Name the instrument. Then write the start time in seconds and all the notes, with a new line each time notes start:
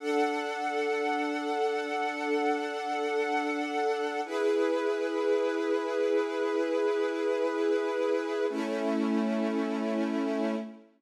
string ensemble 1
0.00 D4 A4 F#5
4.25 E4 G#4 B4
8.50 A3 C#4 E4